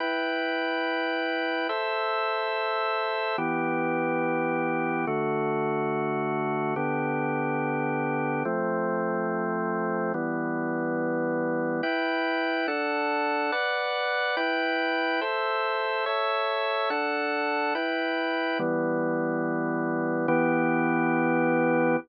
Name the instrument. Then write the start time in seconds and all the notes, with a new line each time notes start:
drawbar organ
0.00 E4 B4 G5
1.69 A4 C5 E5
3.38 E3 B3 G4
5.07 D3 A3 F#4
6.76 D3 B3 G4
8.45 F3 A3 C4
10.14 E3 G3 B3
11.83 E4 B4 G5
12.68 D4 A4 F#5
13.52 B4 D5 F#5
14.37 E4 B4 G5
15.21 A4 C5 E5
16.06 A4 C#5 E5
16.90 D4 A4 F#5
17.75 E4 B4 G5
18.59 E3 G3 B3
20.28 E3 B3 G4